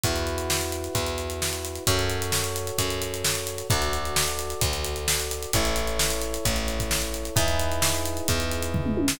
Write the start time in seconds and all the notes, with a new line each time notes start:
0.04 E2 E4 F#4 B4, kick, closed hi-hat
0.16 closed hi-hat
0.27 closed hi-hat
0.38 closed hi-hat
0.50 snare
0.61 closed hi-hat
0.72 closed hi-hat
0.84 closed hi-hat
0.95 E2, kick, closed hi-hat
1.06 closed hi-hat
1.18 closed hi-hat
1.30 closed hi-hat
1.42 snare
1.53 closed hi-hat
1.65 closed hi-hat
1.75 closed hi-hat
1.87 F#2 F#4 A4 C#5, kick, closed hi-hat
1.99 closed hi-hat
2.10 closed hi-hat
2.22 closed hi-hat
2.32 snare
2.44 closed hi-hat
2.56 closed hi-hat
2.67 closed hi-hat
2.78 F#2, kick, closed hi-hat
2.90 closed hi-hat
3.02 closed hi-hat
3.14 closed hi-hat
3.24 snare
3.35 closed hi-hat
3.47 closed hi-hat
3.58 closed hi-hat
3.70 D2 F#4 A4 D5, kick, closed hi-hat
3.82 closed hi-hat
3.93 closed hi-hat
4.05 closed hi-hat
4.16 snare
4.28 closed hi-hat
4.39 closed hi-hat
4.50 closed hi-hat
4.61 D2, kick, closed hi-hat
4.73 closed hi-hat
4.84 closed hi-hat
4.96 closed hi-hat
5.08 snare
5.20 closed hi-hat
5.31 closed hi-hat
5.43 closed hi-hat
5.53 A1 E4 A4 C#5, kick, closed hi-hat
5.65 closed hi-hat
5.76 closed hi-hat
5.87 closed hi-hat
5.99 snare
6.10 closed hi-hat
6.21 closed hi-hat
6.34 closed hi-hat
6.45 A1, kick, closed hi-hat
6.56 closed hi-hat
6.68 closed hi-hat
6.80 kick, closed hi-hat
6.91 snare
7.02 closed hi-hat
7.14 closed hi-hat
7.25 closed hi-hat
7.36 E2 D#4 E4 G#4 B4, kick, closed hi-hat
7.48 closed hi-hat
7.60 closed hi-hat
7.72 closed hi-hat
7.82 snare
7.95 closed hi-hat
8.06 closed hi-hat
8.17 closed hi-hat
8.28 E2, kick, closed hi-hat
8.40 closed hi-hat
8.51 closed hi-hat
8.62 closed hi-hat
8.74 kick, floor tom
8.86 mid tom
8.97 high tom
9.08 snare